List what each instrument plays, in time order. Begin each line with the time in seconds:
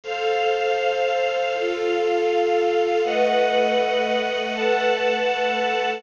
0.04 string ensemble 1 A4 C5 F5, pad 5 (bowed) A4 C5 F5
1.53 pad 5 (bowed) F4 A4 F5, string ensemble 1 F4 A4 F5
3.03 pad 5 (bowed) A3 B4 D#5 F#5, string ensemble 1 A4 B4 D#5 F#5
4.54 pad 5 (bowed) A3 A4 B4 F#5, string ensemble 1 A4 B4 F#5 A5